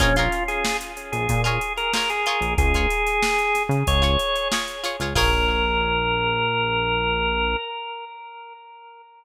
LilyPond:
<<
  \new Staff \with { instrumentName = "Drawbar Organ" } { \time 4/4 \key bes \minor \tempo 4 = 93 des'16 f'8 aes'8 r8 aes'8 aes'8 bes'16 bes'16 aes'8. | aes'2 des''4 r4 | bes'1 | }
  \new Staff \with { instrumentName = "Pizzicato Strings" } { \time 4/4 \key bes \minor <f' aes' bes' des''>16 <f' aes' bes' des''>2 <f' aes' bes' des''>8. <f' aes' bes' des''>8 <f' aes' des''>8~ | <f' aes' des''>16 <f' aes' des''>2 <f' aes' des''>8. <f' aes' des''>8 <f' aes' des''>16 <f' aes' des''>16 | <f' aes' bes' des''>1 | }
  \new Staff \with { instrumentName = "Synth Bass 1" } { \clef bass \time 4/4 \key bes \minor bes,,4.~ bes,,16 bes,,16 bes,4.~ bes,16 bes,,16 | des,4.~ des,16 des16 des,4.~ des,16 des,16 | bes,,1 | }
  \new DrumStaff \with { instrumentName = "Drums" } \drummode { \time 4/4 <hh bd>16 hh16 hh16 hh16 sn16 hh16 hh16 hh16 <hh bd>16 hh16 hh16 hh16 sn16 hh16 hh16 hh16 | <hh bd>16 <hh bd>16 hh16 hh16 sn16 hh16 <hh sn>16 hh16 <hh bd>16 hh16 hh16 hh16 sn16 hh16 hh16 hh16 | <cymc bd>4 r4 r4 r4 | }
>>